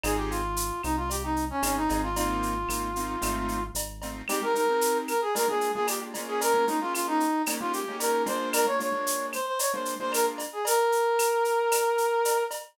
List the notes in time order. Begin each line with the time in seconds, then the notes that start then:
0.03 G#1 C4 D#4 F4 G#4, cowbell, claves, shaker
0.17 G4
0.30 F4, shaker
0.56 shaker
0.83 C2 D#4, claves, shaker
0.97 F4
1.10 G4, cowbell, shaker
1.23 D#4
1.36 shaker
1.50 C#4
1.62 G#1 C4 C#4 D#4 F4 G#4, cowbell, claves, shaker
1.76 D#4
1.89 G#1 C4 D#4 F4 G#4, cowbell, shaker
2.03 F4
2.16 A#3 C4 D#4 F4, cowbell, shaker
2.43 shaker
2.68 G#1 A#3 C4 D#4 F4, claves, shaker
2.96 A#3 C4 D#4 F4, shaker
3.21 G#1 A3 C4 D#4 F4, cowbell, claves, shaker
3.48 shaker
3.74 G#1, cowbell, shaker
4.02 A3 C4 D#4 F4, cowbell, shaker
4.28 G#3 C4 D#4 G4, cowbell, claves, shaker
4.42 G#3 C4 D#4 G4 A#4
4.55 G#3 C4 D#4 G4 A#4, shaker
4.69 G#3 C4 D#4 G4
4.81 shaker
5.08 A#4, claves, shaker
5.21 G#4
5.35 G#3 A#3 D4 F4 A#4, cowbell, shaker
5.48 G#3 A#3 D4 F4 G#4
5.61 shaker
5.74 G#3 A#3 D4 F4 G#4
5.87 G4, cowbell, claves, shaker
6.14 G#3 A#3 C#4 F4, cowbell, shaker
6.28 G#4
6.41 A#4, cowbell, shaker
6.54 G#3 A#3 C#4 F4
6.67 G#3 A#3 C#4 D#4 F4, shaker
6.81 G#3 A#3 C#4 F4
6.94 F4, claves, shaker
7.07 D#4
7.20 shaker
7.46 G#3 A#3 C#4 D#4 G4, cowbell, claves, shaker
7.60 G#3 A#3 C#4 D#4 F4 G4
7.73 G4, shaker
7.88 G#3 A#3 C#4 D#4 G4
8.00 A#4, cowbell, shaker
8.26 G#3 A#3 D4 F4 C5, cowbell, shaker
8.53 A#4, cowbell, claves, shaker
8.66 G#3 A#3 D4 F4 C#5
8.79 G#3 A#3 D4 F4 C#5, shaker
8.92 G#3 A#3 D4 F4
9.07 shaker
9.33 C5, claves, shaker
9.46 C5
9.59 C#5, cowbell, shaker
9.73 G#3 A#3 D4 F4 C5
9.85 shaker
9.99 G#3 A#3 D4 F4 C5
10.12 A#4, cowbell, claves, shaker
10.38 cowbell, shaker
10.53 G#4
10.65 A#4, cowbell, shaker
10.92 shaker
11.19 claves, shaker
11.45 shaker
11.71 cowbell, claves, shaker
11.98 shaker
12.25 cowbell, shaker
12.51 cowbell, shaker